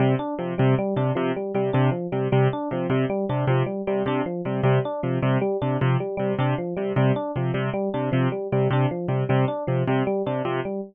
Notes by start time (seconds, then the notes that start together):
0.00 C3 G3
0.19 D4
0.39 C3 F3
0.58 C3 G3
0.79 G3
0.96 C3 D4
1.15 C3 F3
1.36 G3
1.54 C3 G3
1.73 C3 D4
1.91 F3
2.12 C3 G3
2.32 C3 G3
2.53 D4
2.71 C3 F3
2.90 C3 G3
3.10 G3
3.29 C3 D4
3.47 C3 F3
3.66 G3
3.87 C3 G3
4.06 C3 D4
4.26 F3
4.45 C3 G3
4.63 C3 G3
4.85 D4
5.03 C3 F3
5.22 C3 G3
5.41 G3
5.62 C3 D4
5.81 C3 F3
6.00 G3
6.17 C3 G3
6.39 C3 D4
6.58 F3
6.77 C3 G3
6.96 C3 G3
7.16 D4
7.36 C3 F3
7.54 C3 G3
7.74 G3
7.94 C3 D4
8.12 C3 F3
8.32 G3
8.52 C3 G3
8.71 C3 D4
8.91 F3
9.08 C3 G3
9.29 C3 G3
9.48 D4
9.67 C3 F3
9.88 C3 G3
10.07 G3
10.26 C3 D4
10.45 C3 F3
10.65 G3